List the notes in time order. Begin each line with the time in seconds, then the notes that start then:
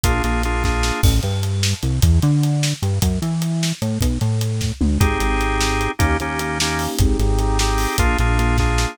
0.04 A#1 A#3 D4 F4 G#4, kick, closed hi-hat
0.24 A#1 A#3 D4 F4 G#4, closed hi-hat
0.43 A#3 D4 F4 G#4, closed hi-hat
0.64 A#3 D4 F4 G#4, kick, snare
0.83 snare
1.03 A1, kick, crash
1.23 G2, closed hi-hat
1.43 closed hi-hat
1.63 snare
1.83 C2, closed hi-hat
2.02 E2, kick, closed hi-hat
2.22 D3, closed hi-hat
2.43 closed hi-hat
2.63 snare
2.82 G2, closed hi-hat
3.02 F#2, kick, closed hi-hat
3.22 E3, closed hi-hat
3.42 closed hi-hat
3.63 snare
3.82 A2, closed hi-hat
4.01 B1, kick, closed hi-hat
4.21 A2, closed hi-hat
4.41 closed hi-hat
4.61 kick, snare
4.81 D2, mid tom
5.00 G#1 C4 D#4 G4 G#4, kick, closed hi-hat
5.20 G#1, closed hi-hat
5.41 closed hi-hat
5.61 snare
5.81 closed hi-hat
5.99 D#2 A#3 C#4 D#4 G4, kick, closed hi-hat
6.20 D#2 A#3 C#4 D#4 G4, closed hi-hat
6.39 A#3 C#4 D#4 G4, closed hi-hat
6.60 A#3 C#4 D#4 G4, snare
6.79 open hi-hat
6.99 G#1 C4 D#4 G4 G#4, kick, closed hi-hat
7.19 G#1 C4 D#4 G4 G#4, closed hi-hat
7.39 C4 D#4 G4 G#4, closed hi-hat
7.59 C4 D#4 G4 G#4, snare
7.78 open hi-hat
7.98 A#1 A#3 D4 F4 G#4, kick, closed hi-hat
8.18 A#1 A#3 D4 F4 G#4, closed hi-hat
8.39 A#3 D4 F4 G#4, closed hi-hat
8.58 A#3 D4 F4 G#4, kick, snare
8.78 snare